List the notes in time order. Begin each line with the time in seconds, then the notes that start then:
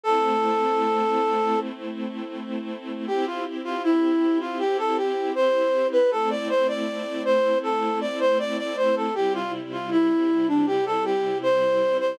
0.03 A3 C4 E4 A4
3.07 C4 E4 G4
3.26 F4
3.64 F4
3.83 E4
4.40 F4
4.59 G4
4.78 A4
4.97 G4
5.35 C5
5.92 B4
6.10 A3 C4 E4 A4
6.30 D5
6.49 C5
6.68 D5
7.25 C5
7.63 A4
8.01 D5
8.20 C5
8.39 D5
8.58 D5
8.77 C5
8.96 A4
9.15 C3 G3 E4 G4
9.34 F4
9.72 F4
9.91 E4
10.48 D4
10.67 G4
10.86 A4
11.05 G4
11.43 C5
12.00 C5